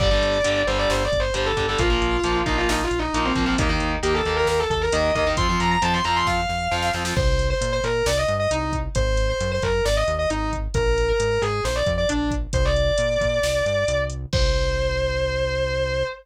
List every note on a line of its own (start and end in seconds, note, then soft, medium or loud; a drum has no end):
0.00 0.19 G1 loud
0.00 0.08 D3 medium
0.00 0.08 G3 medium
0.00 0.60 D5 loud
0.00 kick medium
0.00 crash medium
0.11 0.38 D3 medium
0.11 0.38 G3 medium
0.22 0.41 G1 medium
0.22 closed hi-hat medium
0.44 0.64 G1 medium
0.44 0.62 D3 medium
0.44 0.62 G3 medium
0.44 closed hi-hat medium
0.67 0.86 G1 medium
0.67 1.03 D3 medium
0.67 1.03 G3 medium
0.67 0.78 C5 loud
0.67 closed hi-hat medium
0.78 0.89 D5 loud
0.90 1.09 G1 loud
0.90 1.04 C5 medium
0.90 snare medium
1.04 1.19 D5 medium
1.12 1.31 G1 medium
1.12 kick medium
1.12 closed hi-hat medium
1.19 1.34 C5 medium
1.34 1.53 G1 medium
1.34 1.52 D3 medium
1.34 1.52 G3 medium
1.34 1.45 C5 medium
1.34 closed hi-hat medium
1.46 1.64 A4 medium
1.57 1.76 G1 medium
1.57 1.66 D3 medium
1.57 1.66 G3 medium
1.57 kick medium
1.57 closed hi-hat medium
1.68 1.78 D3 medium
1.68 1.78 G3 medium
1.68 1.79 A4 medium
1.78 1.98 A#1 loud
1.78 1.88 F3 medium
1.78 1.88 A#3 medium
1.78 2.36 F4 loud
1.78 kick medium
1.78 closed hi-hat medium
1.90 2.17 F3 medium
1.90 2.17 A#3 medium
2.01 2.21 A#1 loud
2.01 closed hi-hat medium
2.24 2.43 A#1 medium
2.24 2.42 F3 medium
2.24 2.42 A#3 medium
2.24 closed hi-hat medium
2.46 2.65 A#1 medium
2.46 2.82 F3 medium
2.46 2.82 A#3 medium
2.46 2.57 D#4 loud
2.46 kick medium
2.46 closed hi-hat medium
2.57 2.68 F4 loud
2.69 2.88 A#1 medium
2.69 2.83 D#4 medium
2.69 snare loud
2.84 2.98 F4 medium
2.91 3.10 A#1 medium
2.91 closed hi-hat medium
2.99 3.13 D#4 medium
3.13 3.32 A#1 medium
3.13 3.32 F3 medium
3.13 3.32 A#3 medium
3.13 3.24 D#4 medium
3.13 closed hi-hat medium
3.25 3.46 C4 medium
3.36 3.55 A#1 medium
3.36 3.45 F3 medium
3.36 3.45 A#3 medium
3.36 kick medium
3.36 closed hi-hat medium
3.46 3.55 F3 medium
3.46 3.55 A#3 medium
3.46 3.58 C4 medium
3.58 3.77 D#2 loud
3.58 3.68 D#3 medium
3.58 3.68 A#3 medium
3.58 3.69 D#4 medium
3.58 kick loud
3.58 closed hi-hat medium
3.69 3.96 D#3 medium
3.69 3.96 A#3 medium
3.69 3.89 D#4 loud
3.80 4.00 D#2 medium
3.80 closed hi-hat medium
4.03 4.22 D#2 medium
4.03 4.21 D#3 medium
4.03 4.21 A#3 medium
4.03 4.14 G4 medium
4.03 closed hi-hat medium
4.14 4.33 A4 medium
4.25 4.44 D#2 medium
4.25 4.62 D#3 medium
4.25 4.62 A#3 medium
4.25 closed hi-hat soft
4.37 4.47 A#4 loud
4.47 4.67 D#2 medium
4.47 4.58 A#4 medium
4.47 snare medium
4.59 4.70 A4 medium
4.70 4.89 D#2 loud
4.70 4.81 A4 medium
4.70 kick medium
4.70 closed hi-hat medium
4.81 4.92 A#4 loud
4.92 5.12 D#2 loud
4.92 5.11 D#3 medium
4.92 5.11 A#3 medium
4.92 5.12 D#5 medium
4.92 closed hi-hat loud
5.15 5.34 D#2 medium
5.15 5.24 D#3 medium
5.15 5.24 A#3 medium
5.15 5.26 D#5 medium
5.15 kick medium
5.15 closed hi-hat medium
5.27 5.36 D#3 medium
5.27 5.36 A#3 medium
5.37 5.56 F2 loud
5.37 5.47 F3 medium
5.37 5.47 C4 medium
5.37 5.59 C6 loud
5.37 kick medium
5.37 closed hi-hat medium
5.49 5.76 F3 medium
5.49 5.76 C4 medium
5.60 5.79 F2 medium
5.60 5.70 A#5 medium
5.60 closed hi-hat medium
5.71 5.82 A#5 loud
5.82 6.01 F2 medium
5.82 6.00 F3 medium
5.82 6.00 C4 medium
5.82 5.93 A5 loud
5.82 closed hi-hat medium
5.93 6.04 C6 medium
6.04 6.24 F2 medium
6.04 6.41 F3 medium
6.04 6.41 C4 medium
6.04 6.15 A#5 loud
6.04 closed hi-hat medium
6.16 6.26 C6 medium
6.26 6.46 F2 medium
6.26 6.85 F5 loud
6.26 kick medium
6.26 snare medium
6.49 6.68 F2 medium
6.49 snare soft
6.71 6.91 F2 loud
6.71 6.89 F3 medium
6.71 6.89 C4 medium
6.71 snare medium
6.82 snare medium
6.93 7.13 F2 medium
6.93 7.03 F3 medium
6.93 7.03 C4 medium
6.93 snare medium
7.05 7.14 F3 medium
7.05 7.14 C4 medium
7.05 snare medium
7.16 7.54 C2 loud
7.16 7.44 C5 loud
7.16 kick loud
7.16 crash medium
7.39 closed hi-hat medium
7.50 7.71 C5 medium
7.61 7.80 A#2 loud
7.61 closed hi-hat loud
7.72 7.83 C5 loud
7.84 8.03 A#2 medium
7.84 8.05 A#4 loud
7.84 closed hi-hat medium
8.06 8.25 C2 loud
8.06 8.17 D5 loud
8.06 snare loud
8.17 8.28 D#5 loud
8.28 8.47 G2 loud
8.28 closed hi-hat medium
8.40 8.50 D#5 loud
8.51 8.89 C2 loud
8.51 8.72 D#4 medium
8.51 closed hi-hat medium
8.73 kick medium
8.73 closed hi-hat medium
8.95 9.34 G#1 loud
8.95 9.27 C5 loud
8.95 kick medium
8.95 closed hi-hat medium
9.17 closed hi-hat medium
9.29 9.48 C5 medium
9.40 9.59 F#2 loud
9.40 closed hi-hat medium
9.51 9.62 C5 loud
9.62 9.82 F#2 medium
9.62 9.82 A#4 medium
9.62 kick medium
9.62 closed hi-hat medium
9.85 10.04 G#1 loud
9.85 9.96 D5 loud
9.85 snare medium
9.96 10.07 D#5 medium
10.07 10.26 D#2 loud
10.07 closed hi-hat medium
10.19 10.29 D#5 medium
10.30 10.68 G#1 medium
10.30 10.49 D#4 medium
10.30 closed hi-hat medium
10.53 kick medium
10.53 closed hi-hat medium
10.74 11.13 A#1 loud
10.74 11.06 A#4 loud
10.74 kick medium
10.74 closed hi-hat medium
10.98 closed hi-hat medium
11.08 11.29 A#4 medium
11.19 11.38 G#2 medium
11.19 closed hi-hat medium
11.31 11.41 A#4 medium
11.42 11.61 G#2 loud
11.42 11.61 G#4 loud
11.42 closed hi-hat medium
11.64 11.83 A#1 loud
11.64 11.75 C5 medium
11.64 snare medium
11.75 11.86 D5 medium
11.86 12.06 F2 loud
11.86 kick medium
11.86 closed hi-hat medium
11.98 12.08 D5 loud
12.09 12.47 A#1 medium
12.09 12.28 D4 medium
12.09 closed hi-hat medium
12.31 kick medium
12.31 closed hi-hat medium
12.53 12.92 C2 loud
12.53 12.64 C5 loud
12.53 kick medium
12.53 closed hi-hat medium
12.65 13.98 D5 medium
12.76 closed hi-hat medium
12.98 13.18 A#2 medium
12.98 closed hi-hat medium
13.21 13.40 A#2 medium
13.21 kick medium
13.21 closed hi-hat medium
13.43 13.62 C2 medium
13.43 snare loud
13.66 13.85 G2 medium
13.66 closed hi-hat medium
13.88 14.26 C2 loud
13.88 closed hi-hat medium
14.10 closed hi-hat medium
14.33 16.04 C2 loud
14.33 16.04 C5 loud
14.33 kick loud
14.33 crash loud